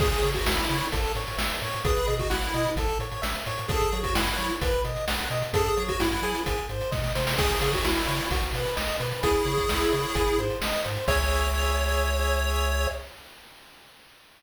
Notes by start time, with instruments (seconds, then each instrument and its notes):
0.00 synth bass 1 C#2, lead 1 (square) G#4, kick, crash
0.12 closed hi-hat
0.22 synth bass 1 C#3, lead 1 (square) C#5, closed hi-hat
0.34 lead 1 (square) F#4, kick, closed hi-hat
0.46 synth bass 1 C#2, lead 1 (square) E4 E5, snare
0.58 closed hi-hat
0.69 synth bass 1 C#3, lead 1 (square) C#5, closed hi-hat
0.81 closed hi-hat
0.92 synth bass 1 A1, lead 1 (square) A4, kick, closed hi-hat
1.04 closed hi-hat
1.15 synth bass 1 A2, lead 1 (square) C#5, closed hi-hat
1.27 closed hi-hat
1.37 synth bass 1 A1, lead 1 (square) E5, snare
1.50 closed hi-hat
1.62 synth bass 1 A2, lead 1 (square) C#5, closed hi-hat
1.73 closed hi-hat
1.85 synth bass 1 B1, lead 1 (square) G#4 B4, kick, closed hi-hat
1.96 closed hi-hat
2.07 synth bass 1 B2, lead 1 (square) D#5, closed hi-hat
2.19 lead 1 (square) F#4, kick, closed hi-hat
2.30 synth bass 1 B1, lead 1 (square) E4 F#5, snare
2.42 closed hi-hat
2.54 synth bass 1 B2, lead 1 (square) D#5, closed hi-hat
2.65 closed hi-hat
2.76 synth bass 1 A1, lead 1 (square) A4, kick, closed hi-hat
2.88 closed hi-hat
2.99 synth bass 1 A2, lead 1 (square) C#5, closed hi-hat
3.12 closed hi-hat
3.22 synth bass 1 A1, lead 1 (square) E5, snare
3.35 closed hi-hat
3.46 synth bass 1 A2, lead 1 (square) C#5, closed hi-hat
3.58 closed hi-hat
3.68 synth bass 1 F#2, lead 1 (square) G#4 A4, kick, closed hi-hat
3.81 closed hi-hat
3.92 synth bass 1 F#3, lead 1 (square) C#5, closed hi-hat
4.03 lead 1 (square) F#4, kick, closed hi-hat
4.14 synth bass 1 F#2, lead 1 (square) E4 F#5, snare
4.27 closed hi-hat
4.37 synth bass 1 F#3, lead 1 (square) C#5, closed hi-hat
4.50 closed hi-hat
4.61 synth bass 1 B1, lead 1 (square) B4, kick, closed hi-hat
4.73 closed hi-hat
4.84 synth bass 1 B2, lead 1 (square) D#5, closed hi-hat
4.96 closed hi-hat
5.07 synth bass 1 B1, lead 1 (square) F#5, snare
5.19 closed hi-hat
5.30 synth bass 1 B2, lead 1 (square) D#5, closed hi-hat
5.42 closed hi-hat
5.53 synth bass 1 F#2, lead 1 (square) G#4 A4, kick, closed hi-hat
5.65 closed hi-hat
5.77 synth bass 1 F#3, lead 1 (square) C#5, closed hi-hat
5.88 lead 1 (square) F#4, kick, closed hi-hat
6.00 synth bass 1 F#2, lead 1 (square) E4 F#5, snare
6.11 closed hi-hat
6.22 synth bass 1 F#3, lead 1 (square) G#4, closed hi-hat
6.35 closed hi-hat
6.46 synth bass 1 G#1, kick, closed hi-hat
6.58 closed hi-hat
6.69 synth bass 1 G#2, lead 1 (square) C5, closed hi-hat
6.81 closed hi-hat
6.92 synth bass 1 B2, lead 1 (square) D#5, kick, snare
7.04 snare
7.15 synth bass 1 C3, lead 1 (square) C5, snare
7.27 snare
7.38 synth bass 1 C#2, lead 1 (square) G#4, kick, crash
7.50 closed hi-hat
7.61 synth bass 1 C#3, lead 1 (square) C#5, closed hi-hat
7.73 lead 1 (square) F#4, kick, closed hi-hat
7.84 synth bass 1 C#2, lead 1 (square) E4 E5, snare
7.96 closed hi-hat
8.07 synth bass 1 C#3, lead 1 (square) C#5, closed hi-hat
8.19 closed hi-hat
8.31 synth bass 1 B1, lead 1 (square) F#4, kick, closed hi-hat
8.42 closed hi-hat
8.53 synth bass 1 B2, lead 1 (square) B4, closed hi-hat
8.65 closed hi-hat
8.76 synth bass 1 B1, lead 1 (square) D#5, snare
8.88 closed hi-hat
9.00 synth bass 1 B2, lead 1 (square) B4, closed hi-hat
9.12 closed hi-hat
9.23 synth bass 1 C#2, lead 1 (square) E4 G#4, kick, closed hi-hat
9.35 closed hi-hat
9.45 synth bass 1 C#3, lead 1 (square) C#5, closed hi-hat
9.58 kick, closed hi-hat
9.69 synth bass 1 C#2, lead 1 (square) E5, snare
9.81 closed hi-hat
9.92 synth bass 1 C#3, lead 1 (square) C#5, closed hi-hat
10.04 closed hi-hat
10.15 synth bass 1 G#1, lead 1 (square) G#4, kick, closed hi-hat
10.27 closed hi-hat
10.38 synth bass 1 G#2, lead 1 (square) C5, closed hi-hat
10.50 closed hi-hat
10.61 synth bass 1 G#1, lead 1 (square) D#5, snare
10.73 closed hi-hat
10.85 synth bass 1 G#2, lead 1 (square) C5, closed hi-hat
10.96 closed hi-hat
11.08 synth bass 1 C#2, lead 1 (square) G#4 C#5 E5, kick, crash